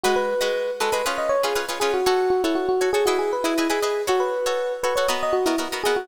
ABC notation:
X:1
M:4/4
L:1/16
Q:1/4=119
K:F#dor
V:1 name="Electric Piano 1"
F B5 A B z d c G z2 G F | F2 F E F F2 G F G B E2 G3 | F B5 B c z d F E z2 G F |]
V:2 name="Pizzicato Strings"
[G,FBd]3 [G,FBd]3 [G,FBd] [G,FBd] [C^EGB]3 [CEGB] [CEGB] [CEGB] [CEGB]2 | [FAc]3 [FAc]3 [FAc] [FAc] [EGBd]3 [EGBd] [EGBd] [EGBd] [EGBd]2 | [FAc]3 [FAc]3 [FAc] [FAc] [B,F^Ad]3 [B,FAd] [B,FAd] [B,FAd] [B,FAd]2 |]